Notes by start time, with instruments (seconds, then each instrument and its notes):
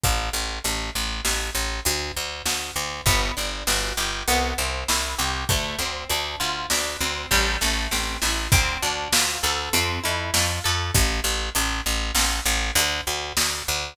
0.04 electric bass (finger) A1, kick, closed hi-hat
0.33 electric bass (finger) A1
0.64 electric bass (finger) A1, closed hi-hat
0.95 electric bass (finger) A1
1.25 electric bass (finger) A1, snare
1.55 electric bass (finger) A1
1.85 electric bass (finger) D2, closed hi-hat
2.17 electric bass (finger) D2
2.46 electric bass (finger) D2, snare
2.76 electric bass (finger) D2
3.06 electric bass (finger) G1, acoustic guitar (steel) B3, kick, closed hi-hat
3.37 electric bass (finger) G1, acoustic guitar (steel) D4
3.67 electric bass (finger) G1, acoustic guitar (steel) F#4, snare
3.97 electric bass (finger) G1, acoustic guitar (steel) G4
4.28 electric bass (finger) C2, acoustic guitar (steel) B3, closed hi-hat
4.58 electric bass (finger) C2, acoustic guitar (steel) C4
4.88 electric bass (finger) C2, acoustic guitar (steel) E4, snare
5.19 electric bass (finger) C2, acoustic guitar (steel) G4
5.49 electric bass (finger) D2, acoustic guitar (steel) A3, kick, closed hi-hat
5.79 electric bass (finger) D2, acoustic guitar (steel) C4
6.09 electric bass (finger) D2, acoustic guitar (steel) D4, closed hi-hat
6.40 electric bass (finger) D2, acoustic guitar (steel) F4
6.70 electric bass (finger) D2, acoustic guitar (steel) D4, snare
7.01 electric bass (finger) D2, acoustic guitar (steel) C4
7.31 electric bass (finger) A1, acoustic guitar (steel) G3, kick, snare
7.61 electric bass (finger) A1, acoustic guitar (steel) A3, snare
7.91 electric bass (finger) A1, acoustic guitar (steel) C4, snare
8.22 electric bass (finger) A1, acoustic guitar (steel) E4, snare
8.52 electric bass (finger) D2, acoustic guitar (steel) C4, kick, closed hi-hat
8.82 electric bass (finger) D2, acoustic guitar (steel) D4
9.13 electric bass (finger) D2, acoustic guitar (steel) F4, snare
9.43 electric bass (finger) D2, acoustic guitar (steel) A4
9.73 electric bass (finger) F2, acoustic guitar (steel) C4, closed hi-hat
10.04 electric bass (finger) F2, acoustic guitar (steel) E4
10.34 electric bass (finger) F2, acoustic guitar (steel) F4, snare
10.64 electric bass (finger) F2, acoustic guitar (steel) A4
10.94 electric bass (finger) A1, kick, closed hi-hat
11.24 electric bass (finger) A1
11.55 electric bass (finger) A1, closed hi-hat
11.86 electric bass (finger) A1
12.15 electric bass (finger) A1, snare
12.46 electric bass (finger) A1
12.75 electric bass (finger) D2, closed hi-hat
13.07 electric bass (finger) D2
13.37 electric bass (finger) D2, snare
13.68 electric bass (finger) D2